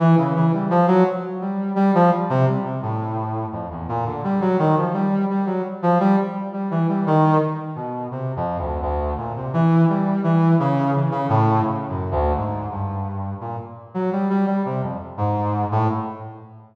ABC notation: X:1
M:5/8
L:1/16
Q:1/4=85
K:none
V:1 name="Brass Section" clef=bass
E, _D, E, G, F, _G, z2 =G,2 | G, F, G, C, G, C, A,,4 | F,, E,, _B,, D, G, _G, _E, F, =G,2 | G, _G, z F, =G, z2 G, E, G, |
_E,2 z2 B,,2 (3C,2 F,,2 D,,2 | D,,2 _B,, C, E,2 G,2 E,2 | _D,2 E, D, A,,2 (3D,2 _G,,2 =D,,2 | _A,,2 G,,4 _B,, z2 _G, |
G, G, G, C, F,, z _A,,3 =A,, |]